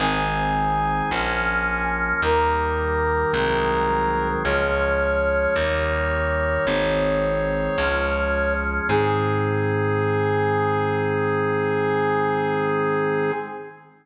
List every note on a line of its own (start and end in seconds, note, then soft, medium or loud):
0.00 1.02 G#1 loud
0.00 1.10 D#3 medium
0.00 1.10 G#3 medium
0.00 1.10 C4 medium
0.00 1.83 G#5 medium
1.11 2.13 A#1 loud
1.11 2.22 F3 medium
1.11 2.22 A#3 medium
1.11 2.22 C#4 medium
2.22 3.25 D#2 loud
2.22 3.32 D#3 medium
2.22 3.32 G3 medium
2.22 3.32 A#3 medium
2.22 4.28 A#4 medium
3.33 4.36 C2 loud
3.33 4.43 D#3 medium
3.33 4.43 F#3 medium
3.33 4.43 G#3 medium
3.33 4.43 C4 medium
4.45 5.47 C#2 loud
4.45 5.55 F3 medium
4.45 5.55 G#3 medium
4.45 5.55 C#4 medium
4.45 8.54 C#5 medium
5.56 6.58 D#2 loud
5.56 6.66 D#3 medium
5.56 6.66 G3 medium
5.56 6.66 A#3 medium
6.67 7.69 G#1 loud
6.67 7.77 D#3 medium
6.67 7.77 G#3 medium
6.67 7.77 C4 medium
7.78 8.80 C#2 loud
7.78 8.88 F3 medium
7.78 8.88 G#3 medium
7.78 8.88 C#4 medium
8.89 13.32 G#2 loud
8.89 13.31 D#3 medium
8.89 13.31 G#3 medium
8.89 13.31 C4 loud
8.89 13.32 G#4 loud